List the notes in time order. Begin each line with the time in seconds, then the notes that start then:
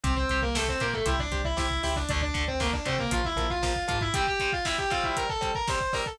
0.04 C2 C4 G4 C5, kick, closed hi-hat
0.16 C4 C5, kick
0.29 C2 G4 C5, kick, closed hi-hat
0.42 A#3 A#4, kick
0.55 A3 G4 A4 C5, kick, snare
0.68 C4 C5, kick
0.80 A#2 A#3 G4 A#4 C5, kick, closed hi-hat
0.93 A3 A4, kick
1.06 C2 E4 G4 C5 E5, kick, closed hi-hat
1.19 D4 D5, kick
1.31 C2 G4 C5, kick, closed hi-hat
1.45 E4 E5, kick
1.57 C2 E4 G4 C5 E5, kick, snare
1.70 kick
1.83 C#2 E4 G4 C5 E5, kick, open hi-hat
1.96 D4 D5, kick
2.09 D2 D3 A3 D4 D5, kick, closed hi-hat
2.21 D4 D5, kick
2.34 D2 D3 A3, kick, closed hi-hat
2.48 C4 C5, kick
2.60 D3 A3 A#3 A#4, kick, snare
2.73 D4 D5, kick
2.85 C3 D3 A3 C4 C5, kick, closed hi-hat
2.99 A#3 A#4, kick
3.11 A#1 F3 A#3 F4 F5, kick, closed hi-hat
3.24 E4 E5, kick
3.36 A#1 F3 A#3, kick, closed hi-hat
3.50 F4 F5, kick
3.63 F3 A#3 F4 F5, kick, snare
3.76 kick
3.88 G#2 F3 A#3 F4 F5, kick, closed hi-hat
4.01 E4 E5, kick
4.13 G3 C4 G4 G5, kick, closed hi-hat
4.27 G4 G5, kick
4.40 G3 C4, kick, closed hi-hat
4.53 F4 F5, kick
4.65 G3 C4 E4 E5, kick, snare
4.78 G4 G5, kick
4.90 G3 C4 F4 F5, kick, closed hi-hat
5.04 E4 E5, kick
5.17 A#4 A#5, kick, closed hi-hat
5.29 A4 A5, kick
5.41 G3 C4, kick, closed hi-hat
5.55 A#4 A#5, kick
5.68 G3 C4 C5 C6, kick, snare
5.81 kick
5.93 G3 C4 A#4 A#5, kick, open hi-hat
6.06 A4 A5, kick